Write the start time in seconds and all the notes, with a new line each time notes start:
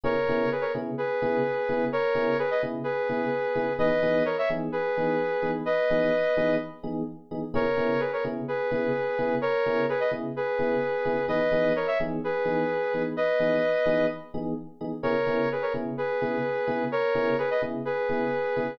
0.04 C#3 B3 E4 G#4 A#4 C#5
0.29 C#3 B3 E4 G#4
0.52 G#4 B4
0.61 A#4 C#5
0.74 C#3 B3 E4 G#4
0.98 G#4 B4
1.22 C#3 B3 E4 G#4
1.69 C#3 B3 E4 G#4
1.92 A#4 C#5
2.15 C#3 B3 E4 G#4
2.39 G#4 B4
2.51 B4 D#5
2.62 C#3 B3 E4 G#4
2.84 G#4 B4
3.09 C#3 B3 E4 G#4
3.55 C#3 B3 E4 G#4
3.79 E3 B3 D#4 G#4 B4 D#5
4.03 E3 B3 D#4 G#4
4.25 A#4 C#5
4.38 C#5 E5
4.50 E3 B3 D#4 G#4
4.72 G#4 B4
4.97 E3 B3 D#4 G#4
5.42 E3 B3 D#4 G#4
5.65 B4 D#5
5.90 E3 B3 D#4 G#4
6.37 E3 B3 D#4 G#4
6.83 E3 B3 D#4 G#4
7.31 E3 B3 D#4 G#4
7.54 C#3 B3 E4 G#4 A#4 C#5
7.77 C#3 B3 E4 G#4
8.00 G#4 B4
8.13 A#4 C#5
8.24 C#3 B3 E4 G#4
8.48 G#4 B4
8.71 C#3 B3 E4 G#4
9.18 C#3 B3 E4 G#4
9.41 A#4 C#5
9.66 C#3 B3 E4 G#4
9.89 G#4 B4
10.00 B4 D#5
10.11 C#3 B3 E4 G#4
10.36 G#4 B4
10.59 C#3 B3 E4 G#4
11.05 C#3 B3 E4 G#4
11.28 E3 B3 D#4 G#4 B4 D#5
11.52 E3 B3 D#4 G#4
11.76 A#4 C#5
11.87 C#5 E5
12.00 E3 B3 D#4 G#4
12.24 G#4 B4
12.45 E3 B3 D#4 G#4
12.94 E3 B3 D#4 G#4
13.17 B4 D#5
13.39 E3 B3 D#4 G#4
13.86 E3 B3 D#4 G#4
14.34 E3 B3 D#4 G#4
14.81 E3 B3 D#4 G#4
15.03 C#3 B3 E4 G#4 A#4 C#5
15.27 C#3 B3 E4 G#4
15.52 G#4 B4
15.62 A#4 C#5
15.74 C#3 B3 E4 G#4
15.98 G#4 B4
16.21 C#3 B3 E4 G#4
16.67 C#3 B3 E4 G#4
16.92 A#4 C#5
17.15 C#3 B3 E4 G#4
17.38 G#4 B4
17.51 B4 D#5
17.62 C#3 B3 E4 G#4
17.85 G#4 B4
18.09 C#3 B3 E4 G#4
18.56 C#3 B3 E4 G#4